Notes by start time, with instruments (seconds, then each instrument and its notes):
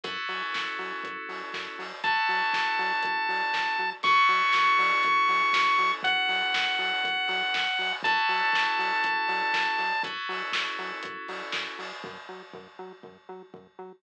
0.04 synth bass 1 F#2, electric piano 2 C#4 E4 F#4 A4, kick, closed hi-hat
0.28 synth bass 1 F#3, open hi-hat
0.54 synth bass 1 F#2, kick, snare
0.79 synth bass 1 F#3, open hi-hat
1.04 synth bass 1 F#2, kick, closed hi-hat
1.29 synth bass 1 F#3, open hi-hat
1.54 synth bass 1 F#2, kick, snare
1.79 synth bass 1 F#3, open hi-hat
2.04 synth bass 1 F#2, electric piano 2 C#4 E4 F#4 A4, lead 1 (square) A5, kick, closed hi-hat
2.29 synth bass 1 F#3, open hi-hat
2.54 synth bass 1 F#2, kick, snare
2.79 synth bass 1 F#3, open hi-hat
3.03 synth bass 1 F#2, kick, closed hi-hat
3.29 synth bass 1 F#3, open hi-hat
3.54 synth bass 1 F#2, kick, snare
3.79 synth bass 1 F#3
4.03 synth bass 1 F#2, electric piano 2 C#4 E4 F#4 A4, lead 1 (square) C#6, kick, closed hi-hat
4.29 synth bass 1 F#3, open hi-hat
4.53 synth bass 1 F#2, kick, snare
4.79 synth bass 1 F#3, open hi-hat
5.03 synth bass 1 F#2, kick, closed hi-hat
5.28 synth bass 1 F#3, open hi-hat
5.53 synth bass 1 F#2, kick, snare
5.78 synth bass 1 F#3, open hi-hat
6.03 synth bass 1 F#2, lead 1 (square) F#5, kick, closed hi-hat
6.29 synth bass 1 F#3, open hi-hat
6.54 synth bass 1 F#2, kick, snare
6.79 synth bass 1 F#3, open hi-hat
7.04 synth bass 1 F#2, kick, closed hi-hat
7.28 synth bass 1 F#3, open hi-hat
7.54 synth bass 1 F#2, kick, snare
7.79 synth bass 1 F#3, open hi-hat
8.03 synth bass 1 F#2, electric piano 2 C#4 E4 F#4 A4, lead 1 (square) A5, kick, closed hi-hat
8.29 synth bass 1 F#3, open hi-hat
8.53 synth bass 1 F#2, kick, snare
8.79 synth bass 1 F#3, open hi-hat
9.04 synth bass 1 F#2, kick, closed hi-hat
9.28 synth bass 1 F#3, open hi-hat
9.54 synth bass 1 F#2, kick, snare
9.78 synth bass 1 F#3, open hi-hat
10.03 synth bass 1 F#2, electric piano 2 C#4 E4 F#4 A4, kick, closed hi-hat
10.29 synth bass 1 F#3, open hi-hat
10.52 synth bass 1 F#2, kick, snare
10.79 synth bass 1 F#3, open hi-hat
11.03 synth bass 1 F#2, kick, closed hi-hat
11.28 synth bass 1 F#3, open hi-hat
11.52 synth bass 1 F#2, kick, snare
11.79 synth bass 1 F#3, open hi-hat
12.04 synth bass 1 F#2, kick
12.29 synth bass 1 F#3
12.54 synth bass 1 F#2, kick
12.79 synth bass 1 F#3
13.03 synth bass 1 F#2, kick
13.29 synth bass 1 F#3
13.54 synth bass 1 F#2, kick
13.79 synth bass 1 F#3